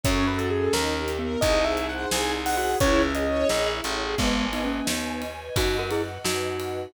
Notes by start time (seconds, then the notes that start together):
0.03 F#2 C#4 F#4 A4 C#5, kick, closed hi-hat
0.27 F#4 B4
0.38 A4, closed hi-hat
0.50 G#4 A4
0.73 D#2 D#4 G4 A#4, snare
0.97 G4
1.08 closed hi-hat
1.19 B3 A#4
1.41 C2 D#4 G#4 C5 D#5, kick, closed hi-hat
1.65 G#4 E5
1.77 closed hi-hat
1.89 C5 F#5
2.11 C2 G#4 G#5, snare
2.34 D#4
2.46 F#5, open hi-hat
2.57 F#4 G#4 F#5
2.80 C#2 C#4 E4 G#4 C#5, kick, closed hi-hat
3.02 G#4 E5
3.15 D#5, closed hi-hat
3.27 C#5
3.49 A#1 G#4, snare
3.72 E4
3.84 A1, closed hi-hat
3.96 G#4
4.18 G#1 G#3 B3 B4 D#5 G#5, kick, crash
4.53 B3 D#4, ride
4.65 A#3 C#4
4.87 D#2 B3 D#4, snare
5.22 ride
5.56 F#2 D#4 F#4 B4 D#5 F#5, kick, ride
5.79 F#4 A#4
5.91 E4 G#4, ride
6.24 F#2 D#4 F#4, snare
6.60 ride